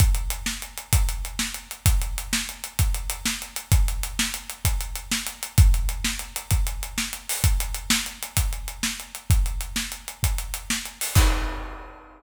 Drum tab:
CC |------------|------------|------------|------------|
HH |xxx-xxxxx-xx|xxx-xxxxx-xx|xxx-xxxxx-xx|xxx-xxxxx-xo|
SD |---o-----o--|---o-----o--|---o-----o--|---o-----o--|
BD |o-----o-----|o-----o-----|o-----o-----|o-----o-----|

CC |------------|------------|x-----------|
HH |xxx-xxxxx-xx|xxx-xxxxx-xo|------------|
SD |---o-----o--|---o-----o--|------------|
BD |o-----o-----|o-----o-----|o-----------|